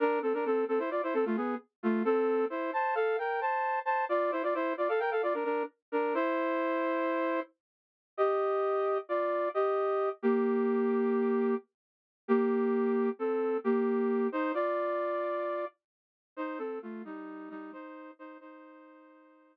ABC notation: X:1
M:9/8
L:1/16
Q:3/8=88
K:Gdor
V:1 name="Brass Section"
[DB]2 [CA] [DB] [CA]2 [CA] [Ec] [Fd] [Ec] [CA] [A,F] [=B,^G]2 z2 [A,F]2 | [CA]4 [Ec]2 [ca]2 [Af]2 [Bg]2 [ca]4 [ca]2 | [Fd]2 [Ec] [Fd] [Ec]2 [Fd] [Af] [Bg] [Af] [Fd] [DB] [DB]2 z2 [DB]2 | [Ec]12 z6 |
[K:Cdor] [Ge]8 [Fd]4 [Ge]6 | [B,G]14 z4 | [B,G]8 [CA]4 [B,G]6 | [Ec]2 [Fd]10 z6 |
[Ec]2 [CA]2 [A,F]2 [G,E]4 [G,E]2 [Ec]4 [Ec]2 | [Ec]16 z2 |]